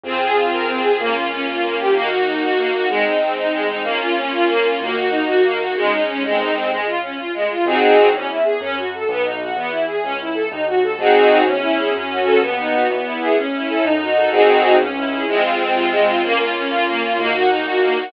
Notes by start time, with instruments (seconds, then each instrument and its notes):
0.04 acoustic grand piano F2, string ensemble 1 C4 F4 G#4
0.21 string ensemble 1 G#4
0.36 string ensemble 1 F4
0.52 acoustic grand piano F2, string ensemble 1 A#4
0.67 string ensemble 1 C4
0.83 string ensemble 1 G#4
0.99 acoustic grand piano C#2, string ensemble 1 A#3 C#4 F4
1.15 string ensemble 1 F4
1.31 string ensemble 1 C#4
1.47 acoustic grand piano C#2, string ensemble 1 F4
1.63 string ensemble 1 A#3
1.79 string ensemble 1 G4
1.94 acoustic grand piano D#2, string ensemble 1 A#3 D#4 F#4
2.10 string ensemble 1 F#4
2.27 string ensemble 1 D#4
2.42 acoustic grand piano D#2, string ensemble 1 F#4
2.57 string ensemble 1 A#3
2.74 string ensemble 1 F#4
2.89 acoustic grand piano G#1, string ensemble 1 G#3 C4 D#4
3.04 string ensemble 1 D#4
3.21 string ensemble 1 C4
3.37 acoustic grand piano G#1, string ensemble 1 D#4
3.52 string ensemble 1 G#3
3.61 acoustic grand piano A1
3.69 string ensemble 1 D#4
3.83 acoustic grand piano A#1, string ensemble 1 A#3 C#4 F4
4.00 string ensemble 1 F4
4.17 string ensemble 1 C#4
4.32 acoustic grand piano A#1, string ensemble 1 F4
4.48 string ensemble 1 A#3
4.65 string ensemble 1 F4
4.79 acoustic grand piano D#2, string ensemble 1 A#3 D#4 F#4
4.97 string ensemble 1 F#4
5.11 string ensemble 1 D#4
5.27 acoustic grand piano D#2, string ensemble 1 F#4
5.44 string ensemble 1 A#3
5.60 string ensemble 1 F#4
5.75 acoustic grand piano G#1, string ensemble 1 G#3 C#4 D#4
5.92 string ensemble 1 D#4
6.08 string ensemble 1 C#4
6.23 acoustic grand piano C2, string ensemble 1 G#3 C4 D#4
6.39 string ensemble 1 D#4
6.55 string ensemble 1 C4
6.70 acoustic grand piano C#2, string ensemble 1 G#3
6.86 string ensemble 1 F4
7.02 string ensemble 1 C#4
7.17 acoustic grand piano A#1, string ensemble 1 F4
7.34 string ensemble 1 G#3
7.42 acoustic grand piano A1
7.50 string ensemble 1 F4
7.65 acoustic grand piano G#1, string ensemble 1 C4 D#4 F#4 G#4
8.13 acoustic grand piano E2, string ensemble 1 C#4
8.29 string ensemble 1 E4
8.44 string ensemble 1 G#4
8.61 acoustic grand piano F#2, string ensemble 1 C#4
8.77 string ensemble 1 F#4
8.94 string ensemble 1 A4
9.09 acoustic grand piano B1, string ensemble 1 B3
9.24 string ensemble 1 D#4
9.41 string ensemble 1 F#4
9.56 acoustic grand piano E2, string ensemble 1 B3
9.71 string ensemble 1 E4
9.87 string ensemble 1 G#4
10.03 acoustic grand piano C#2, string ensemble 1 C#4
10.21 string ensemble 1 E4
10.34 string ensemble 1 A4
10.51 acoustic grand piano D#2, string ensemble 1 D#4
10.67 string ensemble 1 F#4
10.83 string ensemble 1 A4
10.99 acoustic grand piano G#1, string ensemble 1 C4 D#4 F#4 G#4
11.46 acoustic grand piano E2, string ensemble 1 C#4
11.62 string ensemble 1 E4
11.78 string ensemble 1 G#4
11.94 acoustic grand piano F#2, string ensemble 1 C#4
12.10 string ensemble 1 F#4
12.25 string ensemble 1 A4
12.41 acoustic grand piano D#2, string ensemble 1 B3
12.58 string ensemble 1 D#4
12.73 string ensemble 1 F#4
12.89 acoustic grand piano E2, string ensemble 1 B3
13.04 string ensemble 1 E4
13.21 string ensemble 1 G#4
13.37 acoustic grand piano A1, string ensemble 1 C#4
13.53 string ensemble 1 E4
13.69 string ensemble 1 A4
13.84 acoustic grand piano F#2, string ensemble 1 D#4
14.01 string ensemble 1 F#4
14.16 string ensemble 1 A4
14.32 acoustic grand piano C2, string ensemble 1 C4 D#4 F#4 G#4
14.79 acoustic grand piano C#2, string ensemble 1 C#4
14.96 string ensemble 1 E4
15.11 string ensemble 1 G#4
15.28 acoustic grand piano F2, string ensemble 1 G#3 C4 F4
15.44 string ensemble 1 F4
15.59 string ensemble 1 C4
15.75 acoustic grand piano C3, string ensemble 1 F4
15.91 string ensemble 1 G#3
16.07 string ensemble 1 F4
16.23 acoustic grand piano C#2, string ensemble 1 A#3 C#4 F4
16.39 string ensemble 1 F4
16.55 string ensemble 1 C#4
16.70 acoustic grand piano F2, string ensemble 1 F4
16.87 string ensemble 1 A#3
17.03 string ensemble 1 F4
17.18 acoustic grand piano D#2, string ensemble 1 A#3 D#4 F#4
17.34 string ensemble 1 F#4
17.49 string ensemble 1 D#4
17.65 acoustic grand piano A#2, string ensemble 1 F#4
17.82 string ensemble 1 A#3
17.97 string ensemble 1 F#4